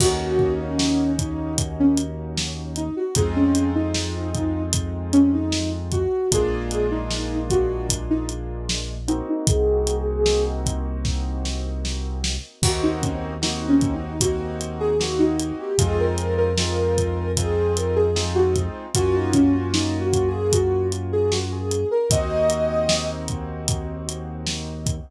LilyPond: <<
  \new Staff \with { instrumentName = "Ocarina" } { \time 4/4 \key ees \dorian \tempo 4 = 76 ges'8. des'8. ees'8 r16 des'16 r4 ees'16 ges'16 | aes'16 des'8 ees'4~ ees'16 r8 des'16 ees'8 r16 ges'8 | aes'8. ees'8. ges'8 r16 ees'16 r4 ees'16 ees'16 | aes'4. r2 r8 |
ges'16 ees'16 des'16 r16 \tuplet 3/2 { ees'8 des'8 ees'8 } ges'8 r16 aes'16 ges'16 ees'8 g'16 | aes'16 bes'8 bes'4~ bes'16 aes'8 bes'16 aes'8 ges'16 r8 | ges'16 ees'16 des'16 r16 \tuplet 3/2 { ees'8 ges'8 aes'8 } ges'8 r16 aes'16 ges'16 aes'8 bes'16 | ees''4. r2 r8 | }
  \new Staff \with { instrumentName = "Acoustic Grand Piano" } { \time 4/4 \key ees \dorian <bes des' ees' ges'>1 | <aes c' ees' f'>1 | <aes bes d' f'>2.~ <aes bes d' f'>8 <bes c' ees' ges'>8~ | <bes c' ees' ges'>1 |
<bes c' ees' ges'>4 <bes c' ees' ges'>4 <bes c' ees' ges'>4 <bes c' ees' ges'>4 | <aes c' ees' f'>4 <aes c' ees' f'>4 <aes c' ees' f'>4 <aes c' ees' f'>4 | <bes des' f' ges'>1 | <bes c' ees' ges'>1 | }
  \new Staff \with { instrumentName = "Synth Bass 2" } { \clef bass \time 4/4 \key ees \dorian ees,1 | f,1 | bes,,1 | c,1 |
ees,1 | f,1 | ges,1 | ees,1 | }
  \new DrumStaff \with { instrumentName = "Drums" } \drummode { \time 4/4 <cymc bd>8 bd8 sn8 <hh bd>8 <hh bd>8 hh8 sn8 hh8 | <hh bd>8 hh8 sn8 <hh bd>8 <hh bd>8 hh8 sn8 <hh bd>8 | <hh bd>8 hh8 sn8 <hh bd>8 <hh bd>8 hh8 sn8 hh8 | <hh bd>8 hh8 sn8 <hh bd>8 <bd sn>8 sn8 sn8 sn8 |
<cymc bd>8 <hh bd>8 sn8 <hh bd>8 <hh bd>8 hh8 sn8 hh8 | <hh bd>8 hh8 sn8 <hh bd>8 <hh bd>8 hh8 sn8 <hh bd>8 | <hh bd>8 <hh bd>8 sn8 <hh bd>8 <hh bd>8 hh8 sn8 hh8 | <hh bd>8 hh8 sn8 <hh bd>8 <hh bd>8 hh8 sn8 <hh bd>8 | }
>>